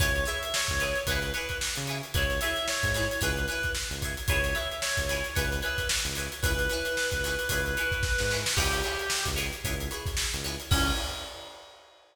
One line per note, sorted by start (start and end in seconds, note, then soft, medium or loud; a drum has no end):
0.00 0.25 C#2 loud
0.00 0.10 E4 loud
0.00 0.10 G#4 loud
0.00 0.10 B4 loud
0.00 0.10 C#5 loud
0.00 0.24 C#5 medium
0.00 kick medium
0.00 closed hi-hat medium
0.16 closed hi-hat medium
0.25 0.45 E4 loud
0.25 0.45 G#4 loud
0.25 0.45 B4 medium
0.25 0.45 C#5 medium
0.25 0.52 E5 medium
0.25 closed hi-hat medium
0.43 closed hi-hat medium
0.54 1.01 C#5 medium
0.54 snare loud
0.68 0.94 C#2 medium
0.68 kick medium
0.68 closed hi-hat soft
0.80 0.91 E4 medium
0.80 0.91 G#4 medium
0.80 0.91 B4 loud
0.80 0.91 C#5 medium
0.80 snare soft
0.80 closed hi-hat medium
0.96 closed hi-hat medium
1.07 1.32 C#2 loud
1.07 1.19 G#4 loud
1.07 1.30 B4 medium
1.07 1.19 B4 loud
1.07 1.19 C#5 loud
1.07 kick medium
1.07 closed hi-hat medium
1.12 1.19 E4 loud
1.22 snare soft
1.22 closed hi-hat medium
1.33 1.54 G#4 medium
1.33 1.56 B4 medium
1.33 1.54 B4 loud
1.33 1.54 C#5 loud
1.33 closed hi-hat medium
1.38 1.54 E4 medium
1.49 kick medium
1.49 closed hi-hat medium
1.61 snare medium
1.75 2.01 C#3 medium
1.75 closed hi-hat medium
1.87 1.99 E4 loud
1.87 1.99 G#4 medium
1.87 1.99 B4 medium
1.87 1.99 C#5 medium
1.87 closed hi-hat medium
2.03 closed hi-hat medium
2.14 2.39 C#2 loud
2.14 2.25 E4 loud
2.14 2.25 G#4 loud
2.14 2.25 B4 loud
2.14 2.25 C#5 loud
2.14 2.41 C#5 medium
2.14 kick medium
2.14 closed hi-hat medium
2.30 closed hi-hat medium
2.41 2.62 G#4 loud
2.41 2.62 B4 medium
2.41 2.62 C#5 medium
2.41 2.65 E5 medium
2.41 snare soft
2.41 closed hi-hat medium
2.45 2.62 E4 medium
2.56 snare soft
2.56 closed hi-hat medium
2.68 3.17 C#5 medium
2.68 snare medium
2.83 3.07 G#2 medium
2.83 kick medium
2.83 closed hi-hat medium
2.94 3.05 E4 loud
2.94 3.05 G#4 loud
2.94 3.05 B4 loud
2.94 3.05 C#5 loud
2.94 snare medium
2.94 closed hi-hat medium
3.11 closed hi-hat medium
3.21 3.47 C#2 loud
3.21 3.32 E4 loud
3.21 3.32 G#4 loud
3.21 3.32 B4 loud
3.21 3.46 B4 medium
3.21 3.32 C#5 loud
3.21 kick medium
3.21 closed hi-hat medium
3.37 closed hi-hat medium
3.48 3.68 E4 loud
3.48 3.68 G#4 medium
3.48 3.70 B4 medium
3.48 3.68 B4 medium
3.48 3.68 C#5 medium
3.48 closed hi-hat medium
3.63 kick medium
3.63 closed hi-hat medium
3.75 snare medium
3.91 4.15 C#2 medium
3.91 closed hi-hat medium
4.02 4.13 E4 loud
4.02 4.13 G#4 loud
4.02 4.13 B4 medium
4.02 4.13 C#5 loud
4.02 kick medium
4.02 closed hi-hat medium
4.17 closed hi-hat medium
4.28 4.54 C#2 loud
4.28 4.39 E4 loud
4.28 4.39 G#4 loud
4.28 4.39 B4 loud
4.28 4.39 C#5 loud
4.28 4.54 C#5 loud
4.28 kick medium
4.28 closed hi-hat medium
4.44 closed hi-hat medium
4.55 4.75 E4 medium
4.55 4.75 G#4 medium
4.55 4.75 B4 medium
4.55 4.75 C#5 medium
4.55 4.78 E5 medium
4.55 closed hi-hat medium
4.72 closed hi-hat medium
4.82 5.31 C#5 medium
4.82 snare medium
4.97 5.22 C#2 medium
4.97 kick medium
4.97 closed hi-hat medium
5.09 5.20 E4 medium
5.09 5.20 G#4 medium
5.09 5.20 B4 medium
5.09 5.20 C#5 medium
5.09 snare soft
5.09 closed hi-hat medium
5.24 snare soft
5.24 closed hi-hat medium
5.35 5.61 C#2 loud
5.35 5.46 E4 loud
5.35 5.46 G#4 loud
5.35 5.60 B4 medium
5.35 5.46 B4 loud
5.35 5.46 C#5 loud
5.35 kick medium
5.35 closed hi-hat medium
5.52 closed hi-hat medium
5.62 5.83 E4 medium
5.62 5.83 G#4 loud
5.62 5.86 B4 medium
5.62 5.83 B4 medium
5.62 5.83 C#5 medium
5.62 closed hi-hat medium
5.78 kick medium
5.78 closed hi-hat medium
5.89 snare loud
6.05 6.29 C#2 medium
6.05 snare soft
6.05 closed hi-hat medium
6.15 6.28 G#4 loud
6.15 6.28 B4 loud
6.15 6.28 C#5 medium
6.15 closed hi-hat medium
6.20 6.28 E4 medium
6.32 closed hi-hat medium
6.43 6.68 C#2 loud
6.43 6.54 E4 loud
6.43 6.54 G#4 loud
6.43 8.35 B4 medium
6.43 6.54 B4 loud
6.43 6.54 C#5 loud
6.43 kick medium
6.43 closed hi-hat medium
6.59 closed hi-hat medium
6.70 6.90 E4 medium
6.70 6.90 G#4 medium
6.70 6.90 B4 medium
6.70 6.90 C#5 medium
6.70 snare soft
6.70 closed hi-hat medium
6.85 closed hi-hat medium
6.97 snare medium
7.11 7.36 C#2 medium
7.11 kick medium
7.11 closed hi-hat medium
7.24 7.35 E4 medium
7.24 7.35 G#4 medium
7.24 7.35 B4 loud
7.24 7.35 C#5 medium
7.24 snare soft
7.24 closed hi-hat medium
7.39 closed hi-hat medium
7.49 7.75 C#2 loud
7.49 7.61 E4 loud
7.49 7.61 G#4 loud
7.49 7.61 B4 loud
7.49 7.61 C#5 loud
7.49 kick medium
7.49 closed hi-hat medium
7.66 snare soft
7.66 closed hi-hat medium
7.77 7.97 E4 loud
7.77 7.97 G#4 medium
7.77 7.97 B4 loud
7.77 7.97 C#5 medium
7.77 closed hi-hat medium
7.92 kick medium
7.92 closed hi-hat medium
8.03 kick medium
8.03 snare medium
8.18 8.44 G#2 medium
8.18 snare medium
8.30 8.42 E4 medium
8.30 8.42 G#4 medium
8.30 8.42 B4 medium
8.30 8.42 C#5 medium
8.30 snare medium
8.46 snare loud
8.56 8.82 C#2 loud
8.56 8.68 E4 loud
8.56 9.24 G4 medium
8.56 8.68 G#4 loud
8.56 8.68 B4 loud
8.56 8.68 C#5 loud
8.56 kick medium
8.56 crash medium
8.73 snare soft
8.73 closed hi-hat medium
8.83 9.04 E4 loud
8.83 9.04 G#4 medium
8.83 9.04 B4 medium
8.83 9.04 C#5 medium
8.83 closed hi-hat medium
8.99 closed hi-hat medium
9.10 snare medium
9.26 9.51 C#2 loud
9.26 kick medium
9.26 closed hi-hat medium
9.36 9.47 E4 medium
9.36 9.47 G#4 medium
9.36 9.47 B4 medium
9.36 9.47 C#5 loud
9.36 snare soft
9.36 closed hi-hat medium
9.53 closed hi-hat medium
9.65 9.89 C#2 loud
9.65 9.75 E4 medium
9.65 9.75 G#4 loud
9.65 9.75 B4 loud
9.65 9.75 C#5 loud
9.65 kick medium
9.65 closed hi-hat medium
9.80 closed hi-hat medium
9.91 10.11 E4 medium
9.91 10.11 G#4 medium
9.91 10.11 B4 loud
9.91 10.11 C#5 medium
9.91 closed hi-hat medium
10.06 kick medium
10.06 snare soft
10.06 closed hi-hat medium
10.17 snare medium
10.34 10.57 C#2 medium
10.34 closed hi-hat medium
10.44 10.55 E4 medium
10.44 10.55 G#4 medium
10.44 10.55 B4 loud
10.44 10.55 C#5 loud
10.44 closed hi-hat medium
10.60 snare soft
10.60 closed hi-hat medium
10.71 10.92 C#2 loud
10.71 10.91 C#4 loud
10.71 10.92 G#4 loud
10.71 10.92 B4 loud
10.71 10.92 C#5 medium
10.71 kick loud
10.71 crash loud
10.75 10.92 E4 medium